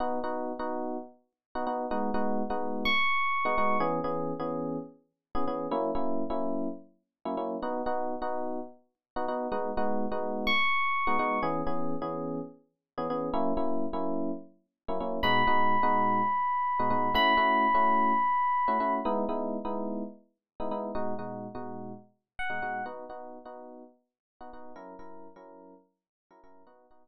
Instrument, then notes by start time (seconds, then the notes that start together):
electric piano 1
0.00 B3 D#4 F#4
0.24 B3 D#4 F#4
0.59 B3 D#4 F#4
1.55 B3 D#4 F#4
1.67 B3 D#4 F#4
1.91 G#3 B3 D#4 F#4
2.14 G#3 B3 D#4 F#4
2.50 G#3 B3 D#4 F#4
2.85 C#6
3.45 G#3 B3 D#4 F#4
3.58 G#3 B3 D#4 F#4
3.80 E3 B3 C#4 G#4
4.04 E3 B3 C#4 G#4
4.40 E3 B3 C#4 G#4
5.35 E3 B3 C#4 G#4
5.48 E3 B3 C#4 G#4
5.71 F#3 A#3 C#4 E4
5.95 F#3 A#3 C#4 E4
6.30 F#3 A#3 C#4 E4
7.25 F#3 A#3 C#4 E4
7.37 F#3 A#3 C#4 E4
7.62 B3 D#4 F#4
7.86 B3 D#4 F#4
8.22 B3 D#4 F#4
9.16 B3 D#4 F#4
9.28 B3 D#4 F#4
9.52 G#3 B3 D#4 F#4
9.77 G#3 B3 D#4 F#4
10.12 G#3 B3 D#4 F#4
10.47 C#6
11.07 G#3 B3 D#4 F#4
11.19 G#3 B3 D#4 F#4
11.43 E3 B3 C#4 G#4
11.67 E3 B3 C#4 G#4
12.02 E3 B3 C#4 G#4
12.98 E3 B3 C#4 G#4
13.10 E3 B3 C#4 G#4
13.34 F#3 A#3 C#4 E4
13.57 F#3 A#3 C#4 E4
13.93 F#3 A#3 C#4 E4
14.88 F#3 A#3 C#4 E4
15.00 F#3 A#3 C#4 E4
15.23 B2 G#3 D#4 F#4 B5
15.47 B2 G#3 D#4 F#4
15.83 B2 G#3 D#4 F#4
16.79 B2 G#3 D#4 F#4
16.90 B2 G#3 D#4 F#4
17.14 A3 C#4 E4 F#4 B5
17.37 A3 C#4 E4 F#4
17.75 A3 C#4 E4 F#4
18.68 A3 C#4 E4 F#4
18.80 A3 C#4 E4 F#4
19.05 G#3 B3 D#4 E4
19.29 G#3 B3 D#4 E4
19.65 G#3 B3 D#4 E4
20.60 G#3 B3 D#4 E4
20.71 G#3 B3 D#4 E4
20.95 B2 G#3 D#4 F#4
21.19 B2 G#3 D#4 F#4
21.55 B2 G#3 D#4 F#4
22.39 F#5
22.50 B2 G#3 D#4 F#4
22.62 B2 G#3 D#4 F#4
22.86 B3 D#4 F#4
23.10 B3 D#4 F#4
23.45 B3 D#4 F#4
24.41 B3 D#4 F#4
24.53 B3 D#4 F#4
24.76 F#3 C#4 E4 A#4
24.99 F#3 C#4 E4 A#4
25.36 F#3 C#4 E4 A#4
26.31 F#3 C#4 E4 A#4
26.44 F#3 C#4 E4 A#4
26.67 B3 D#4 F#4
26.91 B3 D#4 F#4